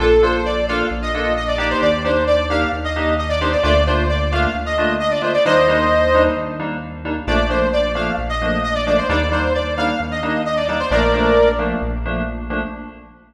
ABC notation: X:1
M:4/4
L:1/16
Q:1/4=132
K:Bb
V:1 name="Lead 2 (sawtooth)"
A2 c2 d2 f2 z e3 e d d c | d2 c2 d2 f2 z e3 e d c d | d2 c2 d2 f2 z e3 e d c d | [ce]8 z8 |
d2 c2 d2 f2 z e3 e d d c | d2 c2 d2 f2 z e3 e d d c | [Bd]6 z10 |]
V:2 name="Electric Piano 2"
[B,DFA]2 [B,DFA]4 [B,DFA]4 [B,DFA]4 [B,DEG]2- | [B,DEG]2 [B,DEG]4 [B,DEG]4 [B,DEG]4 [B,DEG]2 | [A,B,DF]2 [A,B,DF]4 [A,B,DF]4 [A,B,DF]4 [A,B,DF]2 | [G,B,DE]2 [G,B,DE]4 [G,B,DE]4 [G,B,DE]4 [G,B,DE]2 |
[F,A,B,D]2 [F,A,B,D]4 [F,A,B,D]4 [F,A,B,D]4 [F,A,B,D]2 | [G,B,DE]2 [G,B,DE]4 [G,B,DE]4 [G,B,DE]4 [G,B,DE]2 | [F,A,B,D]2 [F,A,B,D]4 [F,A,B,D]4 [F,A,B,D]4 [F,A,B,D]2 |]
V:3 name="Synth Bass 1" clef=bass
B,,,8 B,,,8 | E,,8 E,,8 | D,,8 D,,8 | E,,8 E,,8 |
B,,,8 B,,,8 | E,,8 E,,8 | B,,,8 B,,,8 |]